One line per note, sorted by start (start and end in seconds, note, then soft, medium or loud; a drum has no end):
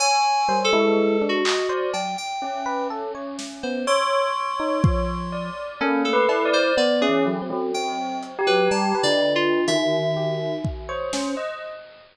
0.00 0.44 C#5 medium
0.00 0.58 G#5 loud
0.48 0.70 G3 medium
0.48 0.70 C5 medium
0.65 1.23 A4 loud
0.73 1.16 G#3 loud
0.73 1.17 E4 loud
1.22 1.43 D4 medium
1.29 1.87 F#4 medium
1.45 1.67 D#5 medium
1.45 clap loud
1.69 1.91 C5 medium
1.69 1.91 D5 medium
1.94 2.16 F#3 soft
1.94 2.15 G5 medium
1.94 cowbell medium
2.18 2.83 G5 medium
2.42 3.73 C#4 medium
2.66 2.88 B4 loud
2.90 3.12 A4 medium
3.15 3.36 C#5 medium
3.39 snare medium
3.63 3.85 B3 medium
3.63 3.85 C5 medium
3.87 5.18 C#5 loud
3.87 5.61 C6 medium
4.60 4.81 D#4 medium
4.84 5.50 F3 medium
4.84 kick loud
5.32 5.76 D5 medium
5.81 6.10 A#3 medium
5.81 6.02 C#4 loud
5.81 6.02 A4 medium
6.05 6.27 A3 medium
6.05 6.48 A4 medium
6.13 6.42 B4 loud
6.29 6.72 E4 medium
6.29 cowbell loud
6.45 6.74 D5 medium
6.53 6.75 C5 loud
6.77 6.99 B3 medium
6.77 7.06 B3 loud
6.77 6.99 D5 medium
7.01 7.23 C#4 loud
7.01 7.23 G#4 medium
7.09 7.38 E3 soft
7.26 7.48 F#3 medium
7.42 7.71 C4 medium
7.50 7.72 F#3 loud
7.74 8.32 C4 medium
7.74 8.18 G5 medium
8.23 closed hi-hat medium
8.39 8.97 G4 loud
8.47 8.69 F#3 loud
8.47 8.69 B4 loud
8.71 8.93 G3 loud
8.71 9.00 A5 medium
8.95 9.60 B4 medium
9.03 9.61 D3 loud
9.03 9.32 D5 loud
9.35 9.65 F4 loud
9.68 10.55 D#3 loud
9.68 10.55 E5 medium
9.68 closed hi-hat loud
10.17 10.38 G4 medium
10.65 10.86 D#3 medium
10.65 kick medium
10.89 11.32 C5 medium
10.89 11.10 C#5 medium
11.13 11.35 C#4 loud
11.13 snare medium
11.37 11.59 D#5 medium